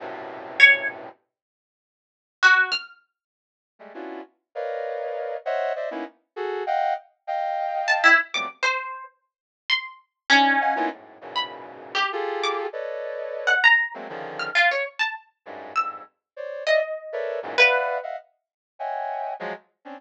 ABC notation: X:1
M:3/4
L:1/16
Q:1/4=99
K:none
V:1 name="Brass Section"
[^F,,G,,A,,B,,C,]8 z4 | z12 | z [G,^G,A,] [B,^CDEF^F]2 z2 [^AB^cd^d=f]6 | [c^c^de^f]2 [=c=d^de] [^A,B,^C^DE] z2 [^F^G=A]2 [d=f^f=g]2 z2 |
[^dfg]6 z [F,^F,G,A,B,C] z4 | z8 [^CD^D]2 [^df^f^g] [^A,B,CDE=F] | [^F,,^G,,A,,]2 [E,,F,,G,,^A,,B,,^C,]6 [=F=G^G=A]4 | [AB^cd^d]6 z2 [^F,^G,A,^A,=C] [^C,=D,^D,=F,]3 |
z6 [^F,,G,,^G,,]2 [=F,,=G,,^G,,]2 z2 | [c^cd]2 [d^de] z2 [A^ABc=de]2 [E,,^F,,^G,,^A,,] [de=f^f]3 [^de=f^f] | z4 [^c^de^fg^g]4 [=F,^F,^G,] z2 [=C^C=D] |]
V:2 name="Orchestral Harp"
z4 ^c2 z6 | z4 ^F2 =f'2 z4 | z12 | z12 |
z4 a E z d' z c3 | z4 c'2 z2 ^C4 | z3 b2 z2 G z2 d' z | z5 ^f ^a2 z3 =f' |
F ^c z a z4 e'2 z2 | z2 ^d6 B3 z | z12 |]